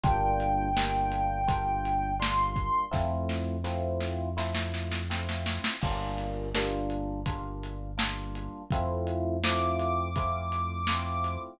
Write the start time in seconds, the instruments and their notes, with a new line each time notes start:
0.04 synth bass 1 G1, electric piano 1 G3 A#3 D4 F4, ocarina G5, kick, closed hi-hat
0.40 closed hi-hat
0.76 electric piano 1 G3 A#3 D4 F4, snare
1.12 closed hi-hat
1.48 electric piano 1 G3 A#3 D4 F4, kick, closed hi-hat
1.85 closed hi-hat
2.20 electric piano 1 G3 A#3 D4 F4, ocarina C6, snare
2.56 kick, closed hi-hat
2.91 synth bass 1 F2, electric piano 1 A3 C4 E4 F4, kick, snare
3.29 snare
3.64 electric piano 1 A3 C4 E4 F4, snare
4.00 snare
4.37 electric piano 1 A3 C4 E4 F4, snare
4.55 snare
4.74 snare
4.92 snare
5.10 electric piano 1 A3 C4 E4 F4, snare
5.29 snare
5.46 snare
5.64 snare
5.82 synth bass 1 G1, electric piano 1 G3 A#3 D4 F4, kick, crash
6.18 closed hi-hat
6.55 electric piano 1 G3 A#3 D4 F4, snare
6.90 closed hi-hat
7.26 electric piano 1 G3 A#3 D4 F4, kick, closed hi-hat
7.63 closed hi-hat
7.98 electric piano 1 G3 A#3 D4 F4, snare
8.35 closed hi-hat
8.71 synth bass 1 F2, electric piano 1 A3 C4 E4 F4, kick, closed hi-hat
9.07 closed hi-hat
9.44 electric piano 1 A3 C4 E4 F4, ocarina D6, snare
9.80 closed hi-hat
10.16 electric piano 1 A3 C4 E4 F4, kick, closed hi-hat
10.52 closed hi-hat
10.87 electric piano 1 A3 C4 E4 F4, snare
11.24 closed hi-hat